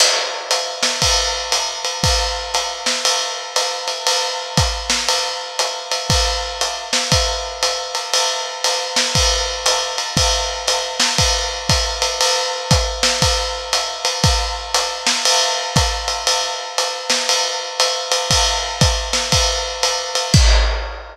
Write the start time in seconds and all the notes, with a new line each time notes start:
0.00 crash, ride
0.51 hi-hat pedal, ride
0.83 snare, ride
1.02 kick, ride
1.52 hi-hat pedal, ride
1.85 ride
2.04 kick, ride
2.54 hi-hat pedal, ride
2.86 snare, ride
3.05 ride
3.56 hi-hat pedal, ride
3.88 ride
4.07 ride
4.57 kick, hi-hat pedal, ride
4.90 snare, ride
5.08 ride
5.59 hi-hat pedal, ride
5.91 ride
6.10 kick, ride
6.61 hi-hat pedal, ride
6.93 snare, ride
7.12 kick, ride
7.63 hi-hat pedal, ride
7.95 ride
8.13 ride
8.64 hi-hat pedal, ride
8.96 snare, ride
9.15 kick, ride
9.66 hi-hat pedal, ride
9.98 ride
10.17 kick, ride
10.68 hi-hat pedal, ride
11.00 snare, ride
11.18 kick, ride
11.69 kick, hi-hat pedal, ride
12.02 ride
12.21 ride
12.71 kick, hi-hat pedal, ride
13.03 snare, ride
13.22 kick, ride
13.73 hi-hat pedal, ride
14.05 ride
14.24 kick, ride
14.74 hi-hat pedal, ride
15.07 snare, ride
15.25 ride
15.76 kick, hi-hat pedal, ride
16.08 ride
16.27 ride
16.78 hi-hat pedal, ride
17.10 snare, ride
17.29 ride
17.80 hi-hat pedal, ride
18.12 ride
18.31 kick, ride
18.81 kick, hi-hat pedal, ride
19.13 snare, ride
19.32 kick, ride
19.83 hi-hat pedal, ride
20.15 ride
20.34 kick, crash